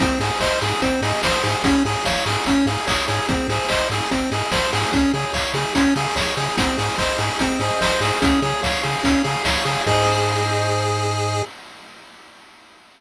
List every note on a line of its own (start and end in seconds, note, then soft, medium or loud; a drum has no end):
0.00 0.12 G#1 loud
0.00 0.19 C4 medium
0.00 0.18 G#4 loud
0.00 kick loud
0.00 closed hi-hat loud
0.20 0.31 G#2 medium
0.20 0.39 G#4 medium
0.20 0.39 C5 medium
0.20 open hi-hat loud
0.40 0.51 G#1 medium
0.40 0.60 C5 medium
0.40 0.59 D#5 medium
0.40 kick loud
0.40 clap loud
0.61 0.73 G#2 medium
0.61 0.80 G#4 medium
0.61 0.81 G#4 medium
0.61 open hi-hat loud
0.82 0.93 G#1 medium
0.82 1.01 C4 medium
0.82 1.01 C5 loud
0.82 kick loud
0.82 closed hi-hat loud
1.02 1.13 G#2 loud
1.02 1.21 G#4 medium
1.02 1.21 D#5 medium
1.02 open hi-hat loud
1.23 1.35 G#1 loud
1.23 1.42 G#4 medium
1.23 1.43 C5 medium
1.23 kick loud
1.23 snare loud
1.43 1.55 G#2 loud
1.43 1.63 G#4 medium
1.43 1.62 C5 medium
1.43 open hi-hat loud
1.63 1.74 G#1 loud
1.63 1.83 C#4 medium
1.63 1.83 G#4 loud
1.63 kick loud
1.63 closed hi-hat loud
1.85 1.96 G#2 medium
1.85 2.04 G#4 medium
1.85 2.03 C#5 medium
1.85 open hi-hat loud
2.05 2.17 G#1 loud
2.05 2.25 C#5 medium
2.05 2.23 F5 medium
2.05 kick medium
2.05 snare loud
2.26 2.37 G#2 medium
2.26 2.45 G#4 medium
2.26 open hi-hat loud
2.45 2.57 G#1 medium
2.45 2.66 C#4 medium
2.45 2.64 C#5 loud
2.45 kick loud
2.45 closed hi-hat loud
2.66 2.77 G#2 loud
2.66 2.86 G#4 medium
2.66 2.85 F5 medium
2.66 open hi-hat loud
2.87 2.99 G#1 loud
2.87 3.06 G#4 medium
2.87 3.06 C#5 medium
2.87 kick loud
2.87 clap loud
3.08 3.20 G#2 loud
3.08 3.27 G#4 medium
3.08 3.26 C#5 loud
3.08 open hi-hat medium
3.29 3.40 G#1 loud
3.29 3.47 C4 medium
3.29 3.48 G#4 loud
3.29 kick loud
3.29 closed hi-hat loud
3.48 3.59 G#2 medium
3.48 3.69 G#4 medium
3.48 3.67 C5 medium
3.48 open hi-hat loud
3.69 3.82 G#1 loud
3.69 3.88 C5 medium
3.69 3.88 D#5 medium
3.69 kick loud
3.69 clap loud
3.90 4.01 G#2 medium
3.90 4.09 G#4 medium
3.90 4.10 G#4 medium
3.90 open hi-hat loud
4.11 4.23 G#1 medium
4.11 4.30 C4 medium
4.11 4.29 C5 medium
4.11 kick medium
4.11 closed hi-hat loud
4.31 4.43 G#2 medium
4.31 4.51 G#4 medium
4.31 4.50 D#5 medium
4.31 open hi-hat loud
4.51 4.63 G#1 medium
4.51 4.71 G#4 medium
4.51 4.71 C5 medium
4.51 kick loud
4.51 snare loud
4.73 4.85 G#2 loud
4.73 4.92 G#4 medium
4.73 4.91 C5 medium
4.73 open hi-hat loud
4.92 5.05 C#2 loud
4.92 5.12 C#4 medium
4.92 5.11 G#4 loud
4.92 kick loud
4.92 closed hi-hat loud
5.13 5.25 C#3 loud
5.13 5.32 G#4 medium
5.13 5.33 C#5 medium
5.13 open hi-hat medium
5.33 5.45 C#2 medium
5.33 5.52 C#5 medium
5.33 5.53 F5 medium
5.33 kick loud
5.33 clap loud
5.54 5.65 C#3 medium
5.54 5.73 G#4 medium
5.54 open hi-hat medium
5.75 5.87 C#2 medium
5.75 5.94 C#4 medium
5.75 5.94 C#5 medium
5.75 kick loud
5.75 closed hi-hat loud
5.96 6.07 C#3 loud
5.96 6.15 G#4 medium
5.96 6.14 F5 medium
5.96 open hi-hat loud
6.16 6.27 C#2 medium
6.16 6.35 G#4 medium
6.16 6.35 C#5 medium
6.16 kick loud
6.16 snare loud
6.36 6.48 C#3 medium
6.36 6.56 G#4 medium
6.36 6.55 C#5 medium
6.36 open hi-hat medium
6.58 6.69 G#1 loud
6.58 6.77 C4 medium
6.58 7.18 G#4 loud
6.58 kick loud
6.58 closed hi-hat loud
6.78 6.89 G#2 medium
6.78 6.97 G#4 medium
6.78 7.40 C5 medium
6.78 open hi-hat loud
6.98 7.10 G#1 loud
6.98 7.17 C5 medium
6.98 7.60 D#5 medium
6.98 kick loud
6.98 clap loud
7.18 7.30 G#2 medium
7.18 7.38 G#4 medium
7.18 7.80 G#4 medium
7.18 open hi-hat loud
7.39 7.51 G#1 medium
7.39 7.60 C4 medium
7.39 8.02 C5 medium
7.39 kick loud
7.39 closed hi-hat loud
7.60 7.71 G#2 medium
7.60 7.79 G#4 medium
7.60 8.19 D#5 medium
7.60 open hi-hat loud
7.80 7.92 G#1 loud
7.80 8.20 G#4 medium
7.80 8.00 C5 medium
7.80 kick loud
7.80 snare loud
8.00 8.12 G#2 loud
8.00 8.20 G#4 medium
8.00 8.22 C5 medium
8.00 open hi-hat loud
8.21 8.34 C#2 loud
8.21 8.41 C#4 medium
8.21 8.83 G#4 loud
8.21 kick loud
8.21 closed hi-hat loud
8.42 8.53 C#3 loud
8.42 8.61 G#4 medium
8.42 9.04 C#5 medium
8.42 open hi-hat medium
8.63 8.75 C#2 loud
8.63 8.82 C#5 medium
8.63 9.23 F5 medium
8.63 kick loud
8.63 snare loud
8.83 8.96 C#3 loud
8.83 9.02 G#4 medium
8.83 9.45 G#4 medium
8.83 open hi-hat medium
9.03 9.15 C#2 medium
9.03 9.22 C#4 medium
9.03 9.66 C#5 medium
9.03 kick loud
9.03 closed hi-hat loud
9.24 9.36 C#3 loud
9.24 9.43 G#4 medium
9.24 9.83 F5 medium
9.24 open hi-hat loud
9.45 9.56 C#2 medium
9.45 9.84 G#4 medium
9.45 9.64 C#5 medium
9.45 kick loud
9.45 snare loud
9.65 9.77 C#3 loud
9.65 9.84 G#4 medium
9.65 9.86 C#5 medium
9.65 open hi-hat loud
9.86 11.42 G#2 loud
9.86 11.42 G#4 loud
9.86 11.43 G#4 loud
9.86 11.42 C5 loud
9.86 11.42 D#5 medium
9.86 kick loud
9.86 crash loud